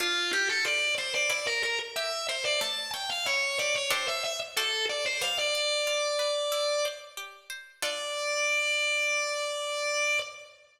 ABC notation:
X:1
M:4/4
L:1/16
Q:1/4=92
K:Dm
V:1 name="Drawbar Organ"
F2 G A d2 c d d B B z e2 c d | a2 g f ^c2 d c =c e e z A2 d c | f d11 z4 | d16 |]
V:2 name="Harpsichord"
D2 A2 F2 A2 E2 B2 G2 B2 | A,2 ^c2 E2 G2 [DGA=c]4 [^FAcd]4 | G,2 d2 F2 =B2 E2 c2 G2 c2 | [DFA]16 |]